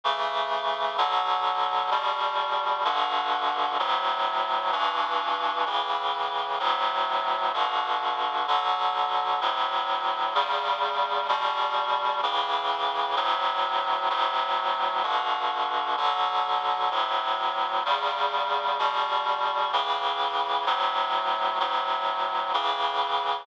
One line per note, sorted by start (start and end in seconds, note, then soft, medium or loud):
0.04 0.97 C#3 medium
0.04 0.97 E3 medium
0.04 0.97 A3 medium
0.98 1.90 B2 medium
0.98 1.90 D3 medium
0.98 1.90 F#3 medium
1.91 2.84 E2 medium
1.91 2.84 B2 medium
1.91 2.84 G3 medium
2.85 3.78 G2 medium
2.85 3.78 B2 medium
2.85 3.78 D3 medium
3.79 4.72 D2 medium
3.79 4.72 A2 medium
3.79 4.72 F#3 medium
4.72 5.65 G2 medium
4.72 5.65 B2 medium
4.72 5.65 E3 medium
5.66 6.59 A2 medium
5.66 6.59 C#3 medium
5.66 6.59 E3 medium
6.60 7.52 D2 medium
6.60 7.52 A2 medium
6.60 7.52 F#3 medium
7.54 8.46 G2 medium
7.54 8.46 B2 medium
7.54 8.46 D3 medium
8.47 9.40 B2 medium
8.47 9.40 D3 medium
8.47 9.40 F#3 medium
9.41 10.34 D2 medium
9.41 10.34 A2 medium
9.41 10.34 F#3 medium
10.35 11.27 E2 medium
10.35 11.27 C#3 medium
10.35 11.27 G3 medium
11.28 12.21 E2 medium
11.28 12.21 B2 medium
11.28 12.21 G3 medium
12.23 13.16 A2 medium
12.23 13.16 C#3 medium
12.23 13.16 E3 medium
13.16 14.09 D2 medium
13.16 14.09 A2 medium
13.16 14.09 F#3 medium
14.10 15.03 D2 medium
14.10 15.03 A2 medium
14.10 15.03 F#3 medium
15.03 15.96 G2 medium
15.03 15.96 B2 medium
15.03 15.96 D3 medium
15.97 16.90 B2 medium
15.97 16.90 D3 medium
15.97 16.90 F#3 medium
16.91 17.84 D2 medium
16.91 17.84 A2 medium
16.91 17.84 F#3 medium
17.85 18.78 E2 medium
17.85 18.78 C#3 medium
17.85 18.78 G3 medium
18.79 19.71 E2 medium
18.79 19.71 B2 medium
18.79 19.71 G3 medium
19.73 20.65 A2 medium
19.73 20.65 C#3 medium
19.73 20.65 E3 medium
20.66 21.59 D2 medium
20.66 21.59 A2 medium
20.66 21.59 F#3 medium
21.60 22.53 D2 medium
21.60 22.53 A2 medium
21.60 22.53 F#3 medium
22.54 23.46 A2 medium
22.54 23.46 C#3 medium
22.54 23.46 E3 medium